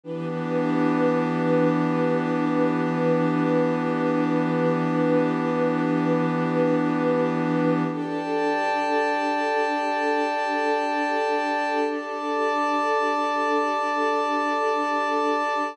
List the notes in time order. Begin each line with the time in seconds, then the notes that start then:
0.03 E3 B3 D4 G4 B4
7.91 D4 G4 A4 D5 G5 A5
11.84 D5 A5 D6